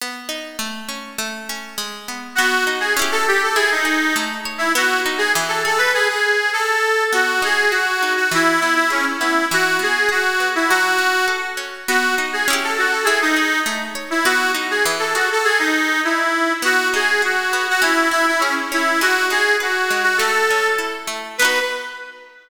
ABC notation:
X:1
M:2/4
L:1/16
Q:1/4=101
K:Bmix
V:1 name="Accordion"
z8 | z8 | F2 z G z A =G A | G D3 z3 E |
F2 z G z A A B | G G3 A4 | F2 G2 F3 F | E2 E E C z E2 |
F2 G2 F3 E | F4 z4 | F2 z G z A F A | G D3 z3 E |
F2 z G z A F A | G D3 E4 | F2 G2 F3 F | E2 E E C z E2 |
F2 G2 F3 F | A4 z4 | B4 z4 |]
V:2 name="Acoustic Guitar (steel)"
B,2 D2 A,2 C2 | A,2 C2 G,2 B,2 | B,2 D2 [CE=G]4 | E2 G2 A,2 c2 |
B,2 D2 E,2 G2 | z8 | B,2 D2 F2 D2 | E,2 B,2 G2 B,2 |
E,2 B,2 G2 B,2 | F,2 C2 A2 C2 | B,2 D2 [CE=G]4 | E2 G2 A,2 c2 |
B,2 D2 E,2 G2 | z8 | B,2 D2 F2 B,2 | C2 E2 G2 C2 |
G,2 D2 B2 G,2 | A,2 C2 E2 A,2 | [B,DF]4 z4 |]